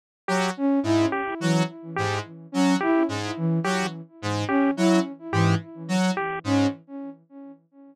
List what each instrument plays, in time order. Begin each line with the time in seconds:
0.28 lead 1 (square) F#3 G4
0.57 flute C#4
0.83 lead 1 (square) G#2, flute E4
1.12 lead 1 (square) G4
1.40 flute E3, lead 1 (square) F#3
1.96 lead 1 (square) G#2 G4
2.52 lead 1 (square) F#3, flute C#4
2.80 flute E4, lead 1 (square) G4
3.09 lead 1 (square) G#2
3.37 flute E3
3.64 lead 1 (square) F#3 G4
4.22 lead 1 (square) G#2
4.48 flute C#4, lead 1 (square) G4
4.77 lead 1 (square) F#3, flute E4
5.32 lead 1 (square) G#2 G4, flute E3
5.88 lead 1 (square) F#3
6.17 lead 1 (square) G4
6.44 lead 1 (square) G#2, flute C#4